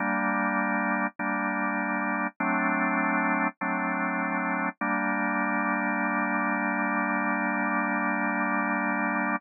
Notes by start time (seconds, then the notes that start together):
0.00 G3 A#3 D4
1.19 G3 A#3 D4
2.40 F#3 A3 C4 D4
3.61 F#3 A3 C4 D4
4.81 G3 A#3 D4